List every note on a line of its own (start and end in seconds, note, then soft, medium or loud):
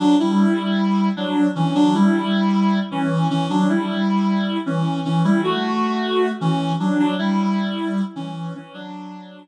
0.00 0.16 F#3 medium
0.00 0.16 D4 loud
0.19 1.09 G3 medium
0.19 1.09 E4 medium
1.17 1.48 F#3 medium
1.17 1.48 D4 medium
1.55 1.74 E3 medium
1.55 1.74 C#4 medium
1.75 1.94 F#3 medium
1.75 1.94 D4 loud
1.94 2.80 G3 medium
1.94 2.80 E4 medium
2.91 3.28 E3 medium
2.91 3.28 C#4 medium
3.30 3.48 E3 medium
3.30 3.48 C#4 medium
3.50 3.68 F#3 medium
3.50 3.68 D4 medium
3.69 4.58 G3 medium
3.69 4.58 E4 medium
4.66 5.01 E3 medium
4.66 5.01 C#4 medium
5.05 5.23 E3 medium
5.05 5.23 C#4 medium
5.24 5.41 G3 medium
5.24 5.41 E4 medium
5.44 6.29 A3 medium
5.44 6.29 F#4 medium
6.41 6.73 E3 medium
6.41 6.73 C#4 medium
6.80 6.99 F#3 medium
6.80 6.99 D4 medium
6.99 7.15 F#3 medium
6.99 7.15 D4 loud
7.18 8.01 G3 medium
7.18 8.01 E4 loud
8.16 8.53 E3 medium
8.16 8.53 C#4 medium
8.54 8.73 E3 medium
8.54 8.73 C#4 medium
8.74 9.40 F#3 medium
8.74 9.40 D4 loud